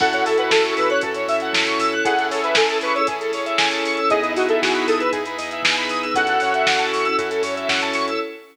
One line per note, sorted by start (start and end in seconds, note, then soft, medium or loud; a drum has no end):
0.00 0.22 F#2 medium
0.00 1.01 C#4 medium
0.00 0.93 C#4 medium
0.00 1.01 E4 medium
0.00 0.93 E4 medium
0.00 1.01 F#4 medium
0.00 0.93 F#4 medium
0.00 1.01 A4 medium
0.00 0.93 A4 medium
0.00 0.12 A4 loud
0.00 0.25 F#5 medium
0.00 kick loud
0.00 crash medium
0.13 0.25 C#5 medium
0.13 closed hi-hat medium
0.26 0.49 F#2 medium
0.26 0.38 A4 medium
0.26 0.37 E5 medium
0.26 open hi-hat medium
0.38 0.51 B4 medium
0.38 0.49 F#5 medium
0.38 closed hi-hat medium
0.50 0.72 F#2 medium
0.50 0.74 A4 medium
0.50 0.63 A5 medium
0.50 kick medium
0.50 snare loud
0.65 0.76 C#6 medium
0.65 closed hi-hat medium
0.77 0.99 F#2 medium
0.77 0.89 B4 medium
0.77 0.88 E6 medium
0.77 open hi-hat medium
0.90 1.02 C#5 medium
0.90 1.01 F#6 medium
0.90 closed hi-hat medium
1.01 1.25 F#2 medium
1.01 2.04 C#4 medium
1.01 1.95 C#4 medium
1.01 2.04 E4 medium
1.01 1.95 E4 medium
1.01 1.95 F#4 medium
1.01 1.14 A4 loud
1.01 2.04 A4 medium
1.01 1.95 A4 medium
1.01 2.04 C#5 medium
1.01 kick medium
1.01 closed hi-hat loud
1.14 1.27 C#5 medium
1.14 closed hi-hat medium
1.28 1.50 F#2 medium
1.28 1.40 E5 medium
1.28 open hi-hat medium
1.40 1.53 F#5 medium
1.40 closed hi-hat medium
1.53 1.75 F#2 medium
1.53 1.65 A5 medium
1.53 kick medium
1.53 snare loud
1.67 1.79 C#6 medium
1.67 closed hi-hat medium
1.79 2.01 F#2 medium
1.79 1.91 E6 medium
1.79 open hi-hat medium
1.92 2.04 F#6 medium
1.92 closed hi-hat medium
2.04 2.28 A1 medium
2.04 2.98 C#4 medium
2.04 3.07 C#4 medium
2.04 2.98 E4 medium
2.04 3.07 E4 medium
2.04 2.16 G#4 medium
2.04 2.98 G#4 medium
2.04 3.07 G#4 medium
2.04 2.98 A4 medium
2.04 3.07 A4 medium
2.04 2.27 F#5 medium
2.04 kick medium
2.04 closed hi-hat loud
2.18 2.29 A4 medium
2.18 closed hi-hat medium
2.30 2.52 A1 medium
2.30 2.43 A4 medium
2.30 2.42 C#5 medium
2.30 open hi-hat medium
2.43 2.56 B4 medium
2.43 2.54 E5 medium
2.43 closed hi-hat medium
2.55 2.80 A1 medium
2.55 2.78 A4 medium
2.55 2.68 G#5 medium
2.55 kick medium
2.55 snare loud
2.69 2.81 A5 medium
2.69 closed hi-hat medium
2.81 3.03 A1 medium
2.81 2.95 B4 medium
2.81 2.94 C#6 medium
2.81 open hi-hat medium
2.95 3.07 C#5 medium
2.95 3.07 E6 medium
2.95 closed hi-hat medium
3.07 3.29 A1 medium
3.07 4.00 C#4 medium
3.07 4.09 C#4 medium
3.07 4.00 E4 medium
3.07 4.09 E4 medium
3.07 3.19 G#4 medium
3.07 4.00 G#4 medium
3.07 4.00 A4 medium
3.07 4.09 A4 medium
3.07 4.09 C#5 medium
3.07 kick medium
3.07 closed hi-hat loud
3.21 3.32 A4 medium
3.21 closed hi-hat medium
3.32 3.54 A1 medium
3.32 3.45 C#5 medium
3.32 open hi-hat medium
3.46 3.57 E5 medium
3.46 closed hi-hat medium
3.58 3.82 A1 medium
3.58 3.70 G#5 loud
3.58 kick medium
3.58 snare loud
3.71 3.83 A5 medium
3.71 closed hi-hat medium
3.84 4.06 A1 medium
3.84 3.96 C#6 medium
3.84 open hi-hat medium
3.97 4.09 E6 medium
3.97 closed hi-hat medium
4.10 4.31 E2 medium
4.10 5.03 B3 medium
4.10 5.12 B3 medium
4.10 5.03 D#4 medium
4.10 5.12 D#4 medium
4.10 5.03 E4 medium
4.10 5.12 E4 medium
4.10 5.03 G#4 medium
4.10 5.12 G#4 medium
4.10 4.22 G#4 loud
4.10 4.33 D#5 medium
4.10 kick medium
4.10 closed hi-hat medium
4.22 4.34 B4 medium
4.22 closed hi-hat medium
4.34 4.56 E2 medium
4.34 4.48 F#4 medium
4.34 4.48 D#5 medium
4.34 open hi-hat medium
4.49 4.61 A4 medium
4.49 4.60 E5 medium
4.49 closed hi-hat medium
4.61 4.85 E2 medium
4.61 4.86 F#4 medium
4.61 4.72 G#5 medium
4.61 kick medium
4.61 snare medium
4.74 4.86 B5 medium
4.74 closed hi-hat medium
4.87 5.09 E2 medium
4.87 5.00 A4 medium
4.87 4.99 D#6 medium
4.87 open hi-hat medium
5.00 5.12 B4 medium
5.00 5.11 E6 medium
5.00 closed hi-hat medium
5.12 5.36 E2 medium
5.12 6.14 B3 medium
5.12 6.05 B3 medium
5.12 6.14 D#4 medium
5.12 6.05 D#4 medium
5.12 6.05 E4 medium
5.12 5.24 G#4 medium
5.12 6.14 G#4 medium
5.12 6.05 G#4 medium
5.12 6.14 B4 medium
5.12 kick medium
5.12 closed hi-hat medium
5.26 5.38 B4 medium
5.26 closed hi-hat medium
5.38 5.60 E2 medium
5.38 5.49 D#5 medium
5.38 open hi-hat medium
5.51 5.63 E5 medium
5.51 closed hi-hat medium
5.63 5.87 E2 medium
5.63 5.76 G#5 medium
5.63 kick medium
5.63 snare loud
5.76 5.89 B5 medium
5.76 closed hi-hat medium
5.89 6.12 E2 medium
5.89 6.02 D#6 medium
5.89 open hi-hat medium
6.02 6.14 E6 medium
6.02 closed hi-hat medium
6.14 6.38 F#2 medium
6.14 7.17 C#4 medium
6.14 7.08 C#4 medium
6.14 7.17 E4 medium
6.14 7.08 E4 medium
6.14 7.17 F#4 medium
6.14 7.08 F#4 medium
6.14 6.27 F#4 loud
6.14 7.17 A4 medium
6.14 7.08 A4 medium
6.14 6.86 F#5 medium
6.14 kick medium
6.14 closed hi-hat loud
6.27 6.40 A4 medium
6.27 closed hi-hat medium
6.40 6.64 F#2 medium
6.40 6.53 C#5 medium
6.40 open hi-hat medium
6.54 6.66 E5 medium
6.54 closed hi-hat medium
6.67 6.90 F#2 medium
6.67 6.79 F#5 medium
6.67 kick medium
6.67 snare loud
6.79 6.90 A5 medium
6.79 closed hi-hat medium
6.92 7.14 F#2 medium
6.92 7.04 C#6 medium
6.92 open hi-hat medium
7.05 7.17 E6 medium
7.05 closed hi-hat medium
7.18 7.40 F#2 medium
7.18 8.11 C#4 medium
7.18 8.20 C#4 medium
7.18 8.11 E4 medium
7.18 8.20 E4 medium
7.18 7.30 F#4 medium
7.18 8.11 F#4 medium
7.18 8.11 A4 medium
7.18 8.20 A4 medium
7.18 8.20 C#5 medium
7.18 kick medium
7.18 closed hi-hat medium
7.31 7.42 A4 medium
7.31 closed hi-hat medium
7.42 7.64 F#2 medium
7.42 7.55 C#5 medium
7.42 open hi-hat medium
7.56 7.68 E5 medium
7.56 closed hi-hat medium
7.69 7.92 F#2 medium
7.69 7.81 F#5 medium
7.69 kick medium
7.69 snare medium
7.82 7.94 A5 medium
7.82 closed hi-hat medium
7.93 8.17 F#2 medium
7.93 8.06 C#6 medium
7.93 open hi-hat medium
8.08 8.19 E6 medium
8.08 closed hi-hat medium